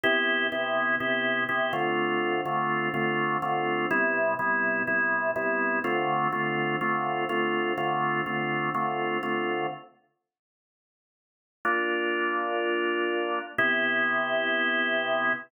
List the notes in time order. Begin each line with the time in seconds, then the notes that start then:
0.04 C3 B3 E4 G4
0.52 C3 B3 E4 G4
1.00 C3 B3 E4 G4
1.49 C3 B3 E4 G4
1.73 D3 A3 C4 F4
2.45 D3 A3 C4 F4
2.94 D3 A3 C4 F4
3.42 D3 A3 C4 F4
3.91 C3 G3 B3 E4
4.39 C3 G3 B3 E4
4.87 C3 G3 B3 E4
5.36 C3 G3 B3 E4
5.84 D3 A3 C4 F4
6.32 D3 A3 C4 F4
6.81 D3 A3 C4 F4
7.29 D3 A3 C4 F4
7.78 D3 A3 C4 F4
8.26 D3 A3 C4 F4
8.74 D3 A3 C4 F4
9.23 D3 A3 C4 F4
11.65 A#3 D4 F4
13.58 C3 B3 E4 G4